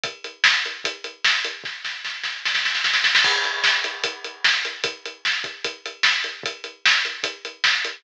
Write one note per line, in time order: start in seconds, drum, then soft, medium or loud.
0.04 kick medium
0.04 closed hi-hat medium
0.24 closed hi-hat medium
0.44 snare medium
0.65 closed hi-hat medium
0.84 kick medium
0.84 closed hi-hat medium
1.04 closed hi-hat medium
1.24 snare medium
1.44 closed hi-hat medium
1.64 kick medium
1.64 snare soft
1.85 snare medium
2.04 snare medium
2.24 snare medium
2.45 snare medium
2.55 snare medium
2.65 snare medium
2.75 snare medium
2.84 snare medium
2.94 snare medium
3.04 snare medium
3.15 snare medium
3.24 kick medium
3.24 crash medium
3.44 closed hi-hat medium
3.64 snare medium
3.84 closed hi-hat medium
4.04 kick medium
4.04 closed hi-hat medium
4.24 closed hi-hat medium
4.44 snare medium
4.65 closed hi-hat medium
4.84 kick medium
4.84 closed hi-hat medium
5.05 closed hi-hat medium
5.25 snare medium
5.44 kick medium
5.44 closed hi-hat medium
5.64 kick medium
5.64 closed hi-hat medium
5.86 closed hi-hat medium
6.03 snare medium
6.24 closed hi-hat medium
6.43 kick medium
6.43 closed hi-hat medium
6.64 closed hi-hat medium
6.86 snare medium
7.05 closed hi-hat medium
7.23 kick medium
7.23 closed hi-hat medium
7.45 closed hi-hat medium
7.64 snare medium
7.84 closed hi-hat medium